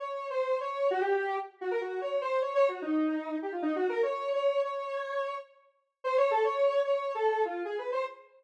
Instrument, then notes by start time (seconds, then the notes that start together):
lead 1 (square)
0.00 C#5
0.30 C5
0.60 C#5
0.91 F#4
1.01 G4
1.61 F#4
1.71 A#4
1.81 F#4
2.01 C#5
2.21 C5
2.42 C#5
2.55 C#5
2.69 F#4
2.82 D#4
3.42 G4
3.52 F4
3.62 D#4
3.76 F#4
3.89 A#4
4.03 C#5
4.33 C#5
4.63 C#5
6.04 C5
6.17 C#5
6.31 A4
6.44 C#5
6.85 C#5
7.15 A4
7.45 F4
7.65 G#4
7.78 B4
7.92 C5